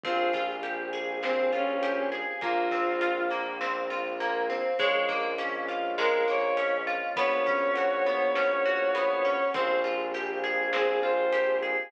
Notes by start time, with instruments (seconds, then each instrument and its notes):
0.03 violin A#1 F4, orchestral harp C4, choir aahs C4 F4 G4 G#4, kick, closed hi-hat
0.33 orchestral harp F4, kick, closed hi-hat
0.63 orchestral harp G4, closed hi-hat
0.93 orchestral harp G#4, closed hi-hat
1.23 orchestral harp C4, violin C4, snare
1.52 violin C#4, orchestral harp F4, closed hi-hat
1.82 orchestral harp G4, closed hi-hat
2.12 orchestral harp G#4, closed hi-hat
2.41 violin A#1 F4, choir aahs A#3 C4 F4, orchestral harp A#3, kick, closed hi-hat
2.71 orchestral harp C4, kick, closed hi-hat
3.01 orchestral harp F4, closed hi-hat
3.30 orchestral harp A#3, closed hi-hat
3.61 orchestral harp C4, snare
3.90 orchestral harp F4, closed hi-hat
4.20 orchestral harp A#3, closed hi-hat
4.50 orchestral harp C4, closed hi-hat
4.79 violin A#1 C#5, choir aahs G#3 A#3 C#4 F4, orchestral harp G#3, kick, closed hi-hat
5.09 orchestral harp A#3, kick, closed hi-hat
5.38 orchestral harp C#4, closed hi-hat
5.68 orchestral harp F4, closed hi-hat
5.98 orchestral harp G#3, violin A#4, snare
6.28 orchestral harp A#3, violin C#5, closed hi-hat
6.57 orchestral harp C#4, closed hi-hat
6.87 orchestral harp F4, closed hi-hat
7.16 violin A#1 C#5, choir aahs B3 C#4 F#4, orchestral harp B3, kick, closed hi-hat
7.46 orchestral harp C#4, kick, closed hi-hat
7.75 orchestral harp F#4, closed hi-hat
8.06 orchestral harp B3, closed hi-hat
8.35 orchestral harp C#4, snare
8.65 orchestral harp F#4, closed hi-hat
8.95 orchestral harp B3, closed hi-hat
9.25 orchestral harp C#4, closed hi-hat
9.54 violin A#1 C5, choir aahs C4 F4 G4 G#4, orchestral harp C4, kick, closed hi-hat
9.84 orchestral harp F4, closed hi-hat
10.14 orchestral harp G4, closed hi-hat
10.44 orchestral harp G#4, closed hi-hat
10.73 orchestral harp C4, violin G#4, snare
11.03 orchestral harp F4, violin C5, closed hi-hat
11.33 orchestral harp G4, closed hi-hat
11.62 orchestral harp G#4, closed hi-hat